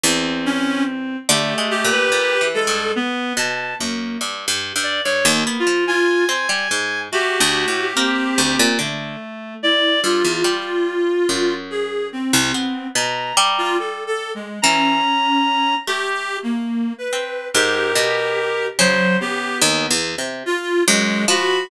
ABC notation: X:1
M:7/8
L:1/16
Q:1/4=72
K:none
V:1 name="Clarinet"
z2 _D2 z2 | G2 G4 A2 z6 | z8 F2 z4 | G8 z4 E2 |
F8 _A2 C4 | z3 F (3A2 A2 _A,2 _D6 | (3G4 _B,4 =B4 G6 | _G,2 =G2 z4 F2 _A,2 _G2 |]
V:2 name="Pizzicato Strings"
E,,6 | (3D,2 _A,2 _B,,2 (3B,,2 E,2 G,,2 z2 =B,,2 _G,,2 | (3G,,2 G,,2 G,,2 G,, _E,, B, F,3 C G, _A,,2 | (3A,2 D,,2 A,,2 _B,2 D,, _B,, D,2 z4 |
G,, E,, G,4 _G,,5 C,, B,2 | B,,2 G,6 E,2 z4 | A,6 C2 _A,,2 B,,4 | _D,4 (3_E,,2 =E,,2 C,2 z2 _G,,2 F,2 |]
V:3 name="Clarinet"
C6 | A,3 B3 _A,2 B,2 =a2 _B,2 | z3 d (3_d2 _B,2 F2 _a6 | _G4 C4 A,4 d2 |
z14 | _b4 z4 b6 | z8 _B6 | c2 B,4 z6 b2 |]